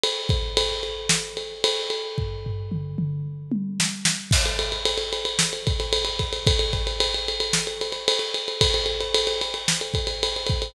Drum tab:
CC |----------------|----------------|x---------------|----------------|
RD |x-x-x-x---x-x-x-|----------------|-xxxxxxx-xxxxxxx|xxxxxxxx-xxxxxxx|
SD |--------o-------|------------o-o-|--------o-------|--------o-------|
T1 |----------------|----------o-----|----------------|----------------|
T2 |----------------|----o-o---------|----------------|----------------|
FT |----------------|o-o-------------|----------------|----------------|
BD |--o-------------|o---------------|o---------o---o-|o-o-------------|

CC |----------------|
RD |xxxxxxxx-xxxxxxx|
SD |--------o-------|
T1 |----------------|
T2 |----------------|
FT |----------------|
BD |o---------o---o-|